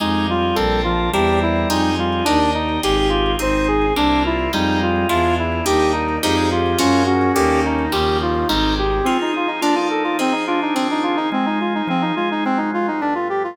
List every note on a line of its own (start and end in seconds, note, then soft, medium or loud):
0.00 0.52 F2 medium
0.00 0.27 G#3 medium
0.00 0.50 D#4 loud
0.00 0.56 D#4 medium
0.00 0.26 D#4 medium
0.00 0.50 F4 loud
0.00 0.56 F4 medium
0.00 0.50 G4 loud
0.00 0.56 G4 medium
0.00 0.50 G#4 loud
0.00 0.56 G#4 medium
0.29 0.81 G3 medium
0.29 0.56 F4 medium
0.55 1.09 A#1 loud
0.55 1.12 C4 medium
0.55 1.07 C4 loud
0.55 1.12 D4 medium
0.55 1.07 D4 loud
0.55 0.81 A4 medium
0.55 1.12 A4 medium
0.55 1.07 A4 loud
0.55 1.12 A#4 medium
0.55 1.07 A#4 medium
0.84 1.10 F3 medium
0.84 1.10 F4 medium
1.13 1.65 E2 loud
1.13 1.92 G3 medium
1.13 1.69 C4 medium
1.13 1.64 C4 medium
1.13 1.69 D4 medium
1.13 1.64 D4 loud
1.13 1.69 E4 medium
1.13 1.64 E4 loud
1.13 1.39 G4 medium
1.13 1.69 A#4 medium
1.13 1.64 A#4 loud
1.42 1.68 E4 medium
1.69 2.22 F2 medium
1.69 1.95 D#4 medium
1.69 2.21 D#4 loud
1.69 2.26 D#4 medium
1.69 2.21 F4 loud
1.69 2.26 F4 medium
1.69 2.21 G4 loud
1.69 2.26 G4 medium
1.69 2.21 G#4 loud
1.69 2.26 G#4 medium
1.98 2.24 G3 medium
1.98 2.25 F4 medium
2.25 2.79 D#2 loud
2.25 2.51 D4 medium
2.25 2.77 D4 loud
2.25 2.83 D4 medium
2.25 2.39 D#4 medium
2.25 2.77 D#4 loud
2.25 2.83 D#4 medium
2.25 2.77 G4 medium
2.25 2.83 G4 medium
2.25 2.77 A#4 loud
2.25 2.83 A#4 medium
2.54 2.81 D#4 medium
2.83 3.35 G#1 loud
2.83 3.34 D#4 loud
2.83 3.39 D#4 medium
2.83 3.34 F4 loud
2.83 3.40 F4 medium
2.83 3.09 G4 medium
2.83 3.34 G4 loud
2.83 3.40 G4 medium
2.83 2.96 G4 medium
2.83 3.34 G#4 loud
2.83 3.39 G#4 medium
2.97 3.32 G4 medium
3.09 3.35 F4 medium
3.39 3.92 G#1 medium
3.39 3.90 C4 loud
3.39 3.96 C4 medium
3.39 3.90 D#4 loud
3.39 3.96 D#4 medium
3.39 3.86 D#4 medium
3.39 3.90 G#4 medium
3.39 3.96 G#4 medium
3.39 3.68 C5 medium
3.68 3.94 G#4 medium
3.96 4.48 C2 medium
3.96 4.52 A#3 medium
3.96 4.47 A#3 loud
3.96 4.52 C4 medium
3.96 4.47 C4 loud
3.96 4.23 D4 medium
3.96 4.52 D4 medium
3.96 4.47 D4 medium
3.96 4.23 D4 medium
3.96 4.52 E4 medium
3.96 4.47 E4 medium
4.25 4.52 E4 medium
4.25 4.48 F4 medium
4.53 5.05 F2 loud
4.53 5.04 G3 loud
4.53 5.09 G3 medium
4.53 5.07 G3 medium
4.53 5.04 G#3 loud
4.53 5.09 G#3 medium
4.53 5.04 D#4 medium
4.53 5.09 D#4 medium
4.53 4.79 D#4 medium
4.53 5.04 F4 loud
4.53 5.09 F4 medium
4.83 5.08 F4 medium
5.09 5.61 E2 loud
5.09 5.65 G#3 medium
5.09 5.60 G#3 loud
5.09 5.65 D4 medium
5.09 5.60 D4 loud
5.09 5.65 E4 medium
5.09 5.60 E4 loud
5.09 5.35 F4 medium
5.09 5.65 F4 medium
5.09 5.60 F4 loud
5.39 5.65 E4 medium
5.65 6.18 D#2 medium
5.65 6.17 G3 loud
5.65 6.22 G3 medium
5.65 6.17 A#3 loud
5.65 6.22 A#3 medium
5.65 6.17 D4 loud
5.65 6.22 D4 medium
5.65 6.16 D#4 medium
5.65 6.17 D#4 loud
5.65 6.22 D#4 medium
5.65 5.92 G4 medium
5.93 6.19 D#4 medium
6.23 6.75 F2 loud
6.23 6.79 F3 medium
6.23 6.74 F3 loud
6.23 6.79 G3 medium
6.23 6.74 G3 loud
6.23 6.79 G#3 medium
6.23 6.74 G#3 loud
6.23 6.79 D#4 medium
6.23 6.74 D#4 loud
6.23 6.49 D#4 medium
6.23 6.36 G4 medium
6.37 6.50 G#4 medium
6.52 6.78 F4 medium
6.52 6.79 G4 medium
6.78 7.31 F#2 medium
6.78 7.29 F3 loud
6.78 7.35 F3 medium
6.78 7.29 F#3 loud
6.78 7.35 F#3 medium
6.78 7.29 G#3 loud
6.78 7.35 G#3 medium
6.78 7.29 A#3 loud
6.78 7.35 A#3 medium
6.78 7.03 C#4 loud
6.78 7.04 F4 medium
7.06 7.85 C#4 medium
7.06 7.32 F#4 medium
7.34 7.88 D#2 loud
7.34 7.87 D3 loud
7.34 7.92 D3 medium
7.34 7.87 D#3 loud
7.34 7.92 D#3 medium
7.34 7.87 G3 loud
7.34 7.92 G3 medium
7.34 7.87 A#3 loud
7.34 7.92 A#3 medium
7.34 7.60 G4 medium
7.66 7.92 D#4 medium
7.92 8.45 D#2 loud
7.92 8.48 C#3 medium
7.92 8.43 C#3 loud
7.92 8.48 D#3 medium
7.92 8.43 D#3 loud
7.92 8.48 F3 medium
7.92 8.43 F3 loud
7.92 8.48 G3 medium
7.92 8.43 G3 loud
7.92 8.18 G4 medium
8.22 8.48 F4 medium
8.48 9.01 G#1 loud
8.48 9.00 C3 medium
8.48 9.05 C3 medium
8.48 9.00 D#3 loud
8.48 9.05 D#3 medium
8.48 9.00 G3 loud
8.48 9.05 G3 medium
8.48 9.00 G#3 loud
8.48 9.05 G#3 medium
8.48 8.74 D#4 medium
8.79 9.05 G4 medium
9.04 9.62 F3 medium
9.04 9.57 F3 medium
9.04 9.17 C4 medium
9.04 9.62 C4 medium
9.04 9.57 C4 medium
9.04 9.62 D#4 medium
9.04 9.57 D#4 medium
9.04 9.32 F4 medium
9.04 9.62 G#4 medium
9.04 9.57 G#4 medium
9.21 9.35 D#4 medium
9.34 9.61 D#4 medium
9.34 9.49 F4 medium
9.47 9.60 D#4 medium
9.61 10.18 F3 medium
9.61 10.13 F3 medium
9.61 10.18 A#3 medium
9.61 10.13 A#3 medium
9.61 9.75 D4 medium
9.61 10.18 D4 medium
9.61 10.13 D4 medium
9.61 9.75 F4 medium
9.61 10.18 A4 medium
9.61 10.13 A4 medium
9.75 10.44 D#4 medium
9.75 9.88 F4 medium
9.90 10.03 A4 medium
10.04 10.17 F4 medium
10.19 10.75 F3 medium
10.19 10.70 F3 medium
10.19 10.75 C4 medium
10.19 10.70 C4 medium
10.19 10.33 C4 medium
10.19 10.75 D#4 medium
10.19 10.70 D#4 medium
10.19 10.75 G#4 medium
10.19 10.70 G#4 medium
10.32 10.45 D#4 medium
10.47 11.17 D4 medium
10.47 10.60 F4 medium
10.62 10.75 D#4 medium
10.74 11.27 D#3 medium
10.74 11.32 D#3 medium
10.74 11.31 F3 medium
10.74 10.88 C4 medium
10.74 11.27 C4 medium
10.74 11.31 C4 medium
10.74 11.27 F4 medium
10.74 11.27 G#4 medium
10.74 11.31 G#4 medium
10.91 11.04 D#4 medium
11.03 11.16 F4 medium
11.16 11.29 D#4 medium
11.32 11.88 F3 medium
11.32 11.82 G#3 medium
11.32 11.88 C4 medium
11.32 11.46 C4 medium
11.32 11.88 D#4 medium
11.32 11.88 G#4 medium
11.46 11.59 D#4 medium
11.60 11.73 F4 medium
11.75 11.88 D#4 medium
11.87 12.12 F3 medium
11.87 12.44 F3 medium
11.87 12.44 C4 medium
11.87 12.02 C4 medium
11.87 12.44 D#4 medium
11.87 12.44 G#4 medium
12.02 12.15 D#4 medium
12.16 12.90 G#3 medium
12.16 12.29 F4 medium
12.31 12.44 D#4 medium
12.45 13.01 G#2 medium
12.45 13.01 F3 medium
12.45 13.01 F#3 medium
12.45 12.58 C4 medium
12.45 13.01 C4 medium
12.57 12.70 D#4 medium
12.74 12.87 F4 medium
12.88 13.01 D#4 medium
13.01 13.57 G2 medium
13.01 13.57 F3 medium
13.01 13.57 A3 medium
13.01 13.57 B3 medium
13.01 13.14 D4 medium
13.15 13.28 F4 medium
13.30 13.43 G4 medium
13.44 13.57 F4 medium